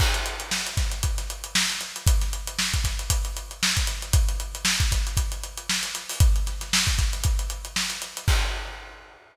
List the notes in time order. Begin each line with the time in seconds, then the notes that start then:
0.00 kick, crash
0.14 snare, closed hi-hat
0.26 closed hi-hat
0.40 closed hi-hat
0.51 snare
0.66 closed hi-hat
0.77 kick, snare, closed hi-hat
0.91 closed hi-hat
1.03 kick, closed hi-hat
1.18 snare, closed hi-hat
1.30 closed hi-hat
1.44 closed hi-hat
1.55 snare
1.70 closed hi-hat
1.81 snare, closed hi-hat
1.96 closed hi-hat
2.07 kick, closed hi-hat
2.21 snare, closed hi-hat
2.33 closed hi-hat
2.47 closed hi-hat
2.59 snare
2.74 kick, closed hi-hat
2.84 kick, snare, closed hi-hat
2.99 closed hi-hat
3.10 kick, closed hi-hat
3.25 closed hi-hat
3.37 closed hi-hat
3.51 closed hi-hat
3.63 snare
3.76 kick, snare, closed hi-hat
3.87 closed hi-hat
4.02 closed hi-hat
4.13 kick, closed hi-hat
4.29 closed hi-hat
4.40 closed hi-hat
4.55 closed hi-hat
4.65 snare
4.80 kick, closed hi-hat
4.91 kick, snare, closed hi-hat
5.07 closed hi-hat
5.17 kick, closed hi-hat
5.32 closed hi-hat
5.44 closed hi-hat
5.57 closed hi-hat
5.70 snare
5.83 snare, closed hi-hat
5.95 closed hi-hat
6.09 open hi-hat
6.20 kick, closed hi-hat
6.36 closed hi-hat
6.46 snare, closed hi-hat
6.61 snare, closed hi-hat
6.73 snare
6.87 kick, closed hi-hat
6.98 kick, snare, closed hi-hat
7.13 closed hi-hat
7.24 kick, closed hi-hat
7.39 closed hi-hat
7.50 closed hi-hat
7.65 closed hi-hat
7.76 snare
7.90 snare, closed hi-hat
8.02 closed hi-hat
8.17 closed hi-hat
8.28 kick, crash